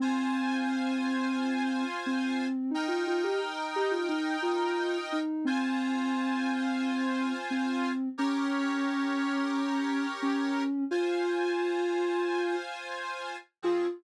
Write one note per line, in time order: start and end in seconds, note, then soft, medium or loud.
0.00 1.84 C4 medium
0.00 2.47 F4 loud
0.00 2.47 C5 loud
0.00 2.47 G#5 loud
2.06 2.71 C4 medium
2.71 2.87 D#4 medium
2.71 5.20 D#4 loud
2.71 5.20 A#4 loud
2.71 5.20 G5 loud
2.88 3.04 F4 medium
3.07 3.24 F4 medium
3.24 3.40 G4 medium
3.76 3.92 G4 medium
3.91 4.08 F4 medium
4.08 4.37 D#4 medium
4.42 4.98 F4 medium
5.12 5.46 D#4 medium
5.45 7.33 C4 medium
5.45 7.92 F4 loud
5.45 7.92 C5 loud
5.45 7.92 G#5 loud
7.50 8.09 C4 medium
8.18 10.06 C#4 medium
8.18 10.63 G4 loud
8.18 10.63 A#4 loud
8.18 10.63 C#5 loud
10.22 10.84 C#4 medium
10.91 13.36 F4 loud
10.91 12.56 F4 medium
10.91 13.36 C5 loud
10.91 13.36 G#5 loud
13.62 13.86 F3 medium
13.62 13.86 C4 loud
13.62 13.88 F4 loud
13.62 13.86 G#4 loud